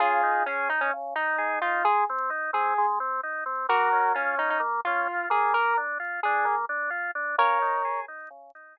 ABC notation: X:1
M:4/4
L:1/16
Q:1/4=130
K:Db
V:1 name="Lead 1 (square)"
[FA]4 D2 E D z2 E4 F2 | A2 z4 A3 z7 | [GB]4 D2 E E z2 F4 A2 | B2 z4 A3 z7 |
[Bd]6 z10 |]
V:2 name="Drawbar Organ"
D,2 E2 A2 E2 D,2 E2 A2 E2 | A,2 C2 E2 C2 A,2 C2 E2 C2 | B,2 D2 F2 D2 B,2 D2 F2 B,2- | B,2 =D2 F2 D2 B,2 D2 F2 D2 |
D,2 E2 A2 E2 D,2 E2 A2 z2 |]